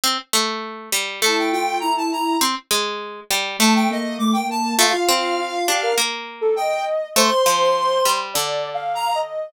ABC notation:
X:1
M:4/4
L:1/16
Q:1/4=101
K:Gm
V:1 name="Lead 1 (square)"
z8 a g g2 b a b2 | z8 a g e2 d' g a2 | f8 z4 g2 z2 | c'8 z4 b2 z2 |]
V:2 name="Ocarina"
z8 =E2 F2 E E E2 | z8 A,2 B,2 A, B, B,2 | F F F2 F2 G B z3 A e4 | c8 (3d4 f4 e4 |]
V:3 name="Pizzicato Strings"
C z A,4 G,2 A,8 | C z _A,4 G,2 =A,8 | A, z C4 D2 B,8 | A, z F,4 G,2 D,8 |]